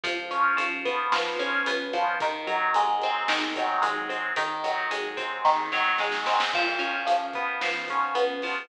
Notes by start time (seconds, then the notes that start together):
0.03 C#2 F3, kick, closed hi-hat
0.31 C#4, closed hi-hat
0.57 G#2 F3, closed hi-hat
0.85 B3, kick, closed hi-hat
1.12 G#2 F3, snare
1.39 C#4, closed hi-hat
1.66 C#2 B3, closed hi-hat
1.93 G#1 F3, closed hi-hat
2.20 D#3, kick, closed hi-hat
2.47 F#3, closed hi-hat
2.74 D#2 G#3, closed hi-hat
3.02 C4, closed hi-hat
3.28 D#2 D#3, snare
3.56 F#3, kick, closed hi-hat
3.82 G#1 G#3, closed hi-hat
4.09 C4, closed hi-hat
4.36 G#1 D#3, kick, closed hi-hat
4.64 F#3, closed hi-hat
4.91 D#2 G#3, closed hi-hat
5.17 C4, kick, closed hi-hat
5.44 D#2 D#3, kick, snare
5.72 F#3, snare
5.98 G#1 G#3, snare
6.12 snare
6.26 C4, snare
6.40 snare
6.53 C#2 F3, kick, crash
6.79 C#4, closed hi-hat
7.07 C#2 F3, closed hi-hat
7.33 B3, kick, closed hi-hat
7.61 G#2 F3, snare
7.88 C#4, kick, closed hi-hat
8.14 C#2 B3, closed hi-hat
8.42 F3, open hi-hat